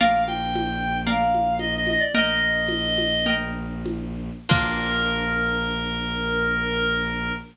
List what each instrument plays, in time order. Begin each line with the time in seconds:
0.00 violin A#1, orchestral harp A#4 D5 F5, clarinet F5, crash, low conga
0.27 clarinet G5, high conga
0.54 tambourine, high conga
1.07 orchestral harp A#4 D5 F5, clarinet F5, low conga
1.34 high conga
1.59 clarinet D#5, tambourine, high conga
1.75 clarinet D#5
1.87 clarinet D#5, high conga
2.00 clarinet D5
2.15 violin A#1, orchestral harp A#4 D#5 G5, clarinet D#5, low conga
2.68 tambourine, high conga
2.98 high conga
3.26 orchestral harp A#4 D#5 G5, low conga
3.86 tambourine, high conga
4.49 violin A#1, orchestral harp A#3 D4 F4, clarinet A#4, kick, crash